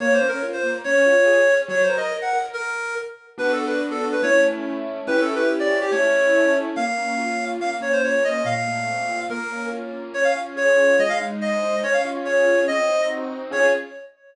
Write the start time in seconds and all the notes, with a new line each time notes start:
0.00 A#3 C#5
0.14 C5
0.21 C#4
0.28 A#4
0.43 F4
0.53 C5
0.63 A#3
0.84 C#4 C#5
1.06 F4
1.26 G#4
1.48 C#4
1.68 F#3 C#5
1.83 C5
1.90 A#4
1.97 D#5
2.11 A#4
2.22 F#5
2.33 A#4
2.53 A#4
3.38 B3 D4 F#4 B4
3.52 A4
3.67 B4
3.91 A4
4.12 B4
4.22 A3 C#4 E4 C#5
5.07 C#4 E4 G4 B4
5.21 A4
5.35 B4
5.59 D5
5.81 G4
5.91 A3 C#4 E4 C#5
6.76 A#3 F5
6.98 C#4
7.18 F4
7.39 C#4
7.60 A#3 F5
7.81 C#4 C#5
7.93 C5
8.03 F4 C#5
8.24 C#4 D#5
8.45 A#2 F5
8.67 A3
8.88 C4
9.09 F4
9.29 A#3 A#4
9.51 C#4
9.71 F4
9.93 C#4
10.13 C#4 C#5
10.24 F5
10.35 F4
10.56 G#4 C#5
10.77 F4
10.99 G#3 D#5
11.09 F5
11.20 D#4
11.40 C5 D#5
11.63 D#4
11.83 C#4 C#5
11.93 F5
12.05 F4
12.25 G#4 C#5
12.46 F4
12.68 C4 D#5
12.89 D#4
13.09 F#4
13.30 D#4
13.51 C#4 F4 G#4 C#5